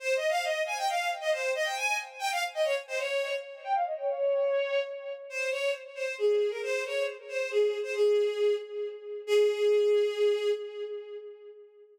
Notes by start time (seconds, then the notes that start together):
0.00 C5
0.16 D#5
0.29 F5
0.44 D#5
0.66 G#5
0.77 G5
0.89 F5
1.20 D#5
1.32 C5
1.55 D#5
1.65 G5
1.76 G#5
2.19 G5
2.32 F5
2.54 D#5
2.64 C#5
2.87 C5
2.98 C#5
3.64 G5
3.75 F5
3.86 D#5
3.98 C#5
5.30 C5
5.51 C#5
5.95 C5
6.18 G#4
6.50 A#4
6.63 C5
6.85 C#5
7.28 C5
7.50 G#4
7.83 C5
7.95 G#4
9.27 G#4